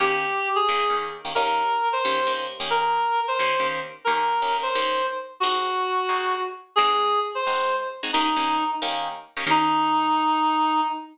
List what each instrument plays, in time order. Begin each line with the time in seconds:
0.00 acoustic guitar (steel) D#3 A#3 C#4 G4, clarinet G4
0.55 clarinet G#4
0.68 acoustic guitar (steel) D#3 A#3 C#4 G4
0.90 acoustic guitar (steel) D#3 A#3 C#4 G4
1.25 acoustic guitar (steel) D#3 A#3 C#4 G4
1.35 acoustic guitar (steel) D#3 A#3 C#4 G4, clarinet A#4
1.93 clarinet C5
2.05 acoustic guitar (steel) D#3 A#3 C#4 G4
2.27 acoustic guitar (steel) D#3 A#3 C#4 G4
2.60 acoustic guitar (steel) D#3 A#3 C#4 G4
2.70 clarinet A#4
3.28 clarinet C5
3.39 acoustic guitar (steel) D#3 A#3 C#4 G4
3.60 acoustic guitar (steel) D#3 A#3 C#4 G4
4.05 acoustic guitar (steel) D#3 A#3 C#4 G4, clarinet A#4
4.42 acoustic guitar (steel) D#3 A#3 C#4 G4
4.63 clarinet C5
4.75 acoustic guitar (steel) D#3 A#3 C#4 G4
5.40 acoustic guitar (steel) G#3 C4 D#4 F#4, clarinet F#4
6.09 acoustic guitar (steel) G#3 C4 D#4 F#4
6.76 acoustic guitar (steel) G#3 C4 D#4 F#4, clarinet G#4
7.35 clarinet C5
7.47 acoustic guitar (steel) G#3 C4 D#4 F#4
8.03 acoustic guitar (steel) G#3 C4 D#4 F#4
8.13 acoustic guitar (steel) D#3 A#3 C#4 G4, clarinet D#4
8.36 acoustic guitar (steel) D#3 A#3 C#4 G4
8.82 acoustic guitar (steel) D#3 A#3 C#4 G4
9.37 acoustic guitar (steel) D#3 A#3 C#4 G4
9.47 acoustic guitar (steel) D#3 A#3 C#4 G4, clarinet D#4